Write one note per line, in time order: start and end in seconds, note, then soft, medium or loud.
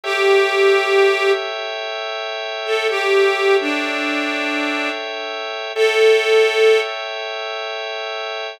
0.04 1.31 G4 loud
0.04 2.88 A4 medium
0.04 2.88 C#5 medium
0.04 2.88 E5 medium
0.04 2.88 G5 medium
2.66 2.87 A4 loud
2.89 3.56 G4 loud
2.89 5.73 A4 medium
2.89 5.73 C#5 medium
2.89 5.73 E5 medium
2.89 5.73 G5 medium
3.61 4.90 D4 loud
5.75 6.79 A4 loud
5.75 8.60 A4 medium
5.75 8.60 C#5 medium
5.75 8.60 E5 medium
5.75 8.60 G5 medium